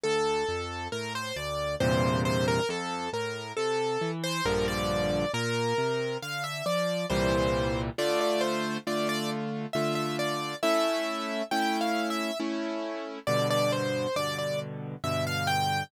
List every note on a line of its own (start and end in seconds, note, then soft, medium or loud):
0.03 0.44 D2 medium
0.03 0.88 A4 loud
0.48 0.88 F2 medium
0.92 1.32 A2 medium
0.92 1.13 A#4 medium
1.15 1.36 C5 medium
1.36 1.76 D2 medium
1.36 1.75 D5 medium
1.80 2.60 E2 medium
1.80 2.60 G2 medium
1.80 2.60 A#2 medium
1.80 2.60 C3 medium
1.80 2.22 C5 medium
2.25 2.46 C5 medium
2.48 2.69 A#4 loud
2.69 3.09 F2 medium
2.69 3.10 A4 medium
3.13 3.53 A2 medium
3.13 3.52 A#4 medium
3.57 3.97 C3 medium
3.57 4.11 A4 medium
4.01 4.41 E3 medium
4.24 4.44 C5 loud
4.45 5.25 A#1 medium
4.45 5.25 G2 medium
4.45 5.25 D3 medium
4.45 5.25 F3 medium
4.45 4.66 A#4 medium
4.68 5.32 D5 medium
5.33 5.73 A#2 medium
5.33 6.17 A#4 loud
5.78 6.17 C3 medium
6.22 6.62 D3 medium
6.22 6.43 F5 medium
6.44 6.65 E5 medium
6.66 7.06 F3 medium
6.66 7.06 D5 medium
7.10 7.90 C2 medium
7.10 7.90 A#2 medium
7.10 7.90 E3 medium
7.10 7.90 G3 medium
7.10 7.81 C5 medium
7.98 8.78 D3 medium
7.98 8.78 A3 medium
7.98 8.78 F4 medium
7.98 8.19 D5 medium
8.21 8.42 D5 medium
8.41 8.77 C5 medium
8.87 9.66 D3 medium
8.87 9.66 A3 medium
8.87 9.66 F4 medium
8.87 9.08 D5 medium
9.09 9.30 D5 loud
9.73 10.54 D3 medium
9.73 10.54 A3 medium
9.73 10.54 F4 medium
9.73 9.94 E5 medium
9.95 10.16 E5 medium
10.19 10.56 D5 medium
10.63 11.42 A3 medium
10.63 11.42 C#4 medium
10.63 11.42 E4 medium
10.63 11.44 E5 loud
11.51 12.31 A3 medium
11.51 12.31 C#4 medium
11.51 12.31 E4 medium
11.51 11.79 G5 medium
11.81 12.09 F5 medium
12.10 12.38 E5 medium
12.40 13.19 A3 medium
12.40 13.19 C#4 medium
12.40 13.19 E4 medium
13.27 14.07 G2 medium
13.27 14.07 B2 medium
13.27 14.07 D3 medium
13.27 13.48 D5 medium
13.50 13.71 D5 loud
13.72 14.15 C5 medium
14.16 14.95 G2 medium
14.16 14.95 B2 medium
14.16 14.95 D3 medium
14.16 14.37 D5 medium
14.38 14.59 D5 medium
15.04 15.83 G2 medium
15.04 15.83 B2 medium
15.04 15.83 D3 medium
15.04 15.25 E5 medium
15.27 15.48 F5 medium
15.47 15.83 G5 medium